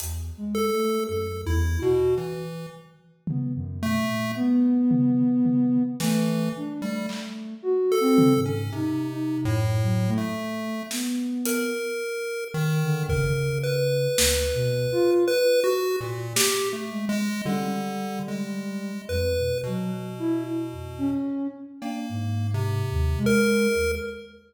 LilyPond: <<
  \new Staff \with { instrumentName = "Ocarina" } { \time 2/4 \tempo 4 = 55 \tuplet 3/2 { e,8 aes8 a8 ges,8 e,8 ges'8 } | r4 b16 ges,16 b,16 bes,16 | b4. a8 | d'16 a8. \tuplet 3/2 { ges'8 c'8 aes,8 } |
\tuplet 3/2 { ees'8 ees'8 ges,8 } ges16 a8. | b8. r4 d16 | des4 \tuplet 3/2 { d,8 b,8 f'8 } | r4. aes16 r16 |
g4. f,16 b,16 | ges16 r16 e'16 r16 f,16 des'8 r16 | d'16 aes,8. ees,16 aes8 ees,16 | }
  \new Staff \with { instrumentName = "Lead 1 (square)" } { \time 2/4 r8 a'8 \tuplet 3/2 { a'8 e'8 b,8 } | e8 r4 a8 | r4. e8 | r16 g16 r8. a'8 des'16 |
\tuplet 3/2 { c4 a,4 a4 } | r8 bes'4 ees8 | bes'8 b'4. | \tuplet 3/2 { b'8 ges'8 bes,8 g'8 a8 aes8 } |
d8. aes8. b'8 | b,4. r8 | \tuplet 3/2 { bes4 c4 bes'4 } | }
  \new DrumStaff \with { instrumentName = "Drums" } \drummode { \time 2/4 hh4 r4 | r4 tomfh4 | r8 tomfh8 tomfh8 sn8 | r8 hc8 r8 tomfh8 |
r4 r4 | sn8 hh8 r4 | bd4 sn4 | r4 sn4 |
tommh4 r4 | r4 r4 | cb4 r4 | }
>>